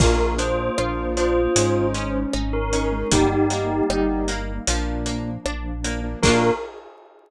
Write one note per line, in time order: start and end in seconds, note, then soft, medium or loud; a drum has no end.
0.00 0.70 A#1 loud
0.00 0.16 A#3 loud
0.00 1.54 A#3 loud
0.00 0.36 A#3 medium
0.00 0.16 D4 loud
0.00 1.54 D4 medium
0.00 0.16 F4 loud
0.00 0.32 F4 medium
0.00 1.54 F4 loud
0.00 0.31 A#4 medium
0.00 kick loud
0.00 crash loud
0.19 0.35 A#3 loud
0.19 0.35 D4 medium
0.19 0.35 F4 medium
0.38 0.70 A#3 medium
0.38 0.73 D4 medium
0.38 0.70 D4 medium
0.38 0.70 F4 medium
0.38 1.06 C5 medium
0.38 closed hi-hat medium
0.78 1.48 A#1 medium
0.78 1.40 A#3 medium
0.78 1.40 D4 medium
0.78 1.13 F4 medium
0.78 1.40 F4 loud
0.78 cross-stick loud
1.17 1.52 D4 medium
1.17 1.86 F4 medium
1.17 2.15 C5 medium
1.17 closed hi-hat medium
1.56 2.26 G#1 loud
1.56 1.91 G#3 medium
1.56 2.18 G#3 loud
1.56 3.10 G#3 medium
1.56 2.18 C#4 loud
1.56 3.10 C#4 loud
1.56 2.18 D#4 loud
1.56 3.10 D#4 medium
1.56 closed hi-hat loud
1.94 2.30 C#4 medium
1.94 2.93 C#4 medium
1.94 closed hi-hat medium
2.33 3.04 G#1 medium
2.33 2.69 D#4 medium
2.33 cross-stick loud
2.53 3.08 A#4 medium
2.73 2.88 G#3 medium
2.73 2.88 C#4 loud
2.73 3.08 C#4 medium
2.73 2.88 D#4 loud
2.73 closed hi-hat medium
2.92 3.08 G#3 medium
2.92 3.08 C#4 medium
2.92 3.08 D#4 loud
3.12 3.82 G1 loud
3.12 3.27 G3 loud
3.12 4.66 G3 loud
3.12 3.75 G3 medium
3.12 3.47 G3 medium
3.12 3.27 A#3 loud
3.12 4.66 A#3 loud
3.12 3.27 D#4 loud
3.12 4.66 D#4 loud
3.12 4.21 D#4 medium
3.12 4.21 G4 medium
3.12 kick loud
3.12 closed hi-hat loud
3.31 3.47 G3 medium
3.31 3.47 A#3 medium
3.31 3.47 D#4 medium
3.50 3.82 G3 medium
3.50 3.82 A#3 medium
3.50 3.86 A#3 medium
3.50 3.82 D#4 medium
3.50 closed hi-hat medium
3.90 4.60 G1 medium
3.90 4.52 G3 loud
3.90 4.52 A#3 loud
3.90 4.52 D#4 medium
3.90 4.25 D#4 medium
3.90 cross-stick loud
4.28 4.64 A#3 medium
4.28 closed hi-hat medium
4.67 5.38 A#1 loud
4.67 5.30 F3 loud
4.67 6.22 F3 loud
4.67 5.03 F3 medium
4.67 5.30 A#3 loud
4.67 6.22 A#3 medium
4.67 5.30 D4 loud
4.67 6.22 D4 loud
4.67 closed hi-hat loud
5.06 5.41 A#3 medium
5.06 closed hi-hat medium
5.45 6.15 A#1 medium
5.45 5.81 D4 medium
5.45 cross-stick loud
5.84 6.00 F3 medium
5.84 6.19 A#3 medium
5.84 6.00 A#3 medium
5.84 6.00 D4 medium
5.84 closed hi-hat medium
6.04 6.19 F3 medium
6.04 6.19 A#3 medium
6.04 6.19 D4 loud
6.23 6.51 A#1 loud
6.23 6.50 A#3 loud
6.23 6.51 A#3 loud
6.23 6.51 D4 loud
6.23 6.50 D4 loud
6.23 6.51 F4 loud
6.23 6.50 F4 loud
6.23 6.50 A#4 loud
6.23 kick loud
6.23 crash loud